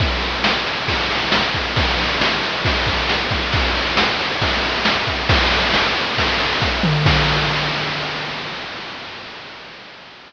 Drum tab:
CC |--------|--------|--------|--------|
RD |xx-xxx-x|xx-xxx-x|xx-xxx-x|xx-xxx--|
SD |--o---o-|--o---o-|--o---o-|--o---o-|
T2 |--------|--------|--------|-------o|
BD |o---o--o|o---oo-o|o---o--o|o---o-o-|

CC |x-------|
RD |--------|
SD |--------|
T2 |--------|
BD |o-------|